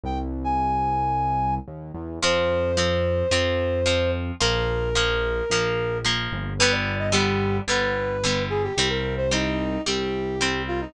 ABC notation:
X:1
M:4/4
L:1/16
Q:1/4=110
K:Fm
V:1 name="Brass Section"
g z2 a9 z4 | c16 | B12 z4 | =B =d2 e G4 B6 A G |
G B2 c E4 G6 F E |]
V:2 name="Acoustic Guitar (steel)"
z16 | [F,C]4 [F,C]4 [F,C]4 [F,C]4 | [F,B,]4 [F,B,]4 [F,B,]4 [F,B,]4 | [=D,G,=B,]4 [D,G,B,]4 [D,G,B,]4 [D,G,B,]4 |
[G,C]4 [G,C]4 [G,C]4 [G,C]4 |]
V:3 name="Synth Bass 1" clef=bass
C,,12 E,,2 =E,,2 | F,,8 F,,8 | B,,,8 B,,,6 G,,,2- | G,,,8 G,,,8 |
C,,8 C,,8 |]